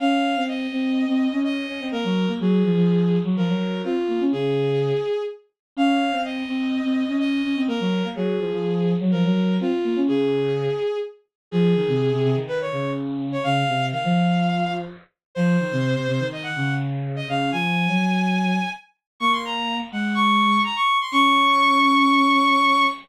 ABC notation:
X:1
M:4/4
L:1/16
Q:1/4=125
K:Db
V:1 name="Violin"
f4 e8 e4 | B4 A8 B4 | F4 A8 z4 | f4 e8 e4 |
B4 A8 B4 | F4 A8 z4 | A8 _c d3 z3 d | f4 f8 z4 |
c8 e g3 z3 e | f2 a10 z4 | d' c' b3 z g2 d'4 b d'2 c' | d'16 |]
V:2 name="Violin"
D3 C3 C3 C2 D3 D C | B, G,2 B, G,2 F, F,4 G, F, G,3 | C z B, D D,6 z6 | D3 C3 C3 C2 D3 D C |
B, G,2 B, G,2 F, F,4 G, F, G,3 | C z B, D D,6 z6 | F,2 E, C,2 C, C, E,3 D,6 | D,2 C,2 E, F,7 z4 |
F,2 E, C,2 C, C, E,3 D,6 | D,2 F,3 G,7 z4 | B,6 A,6 z4 | D16 |]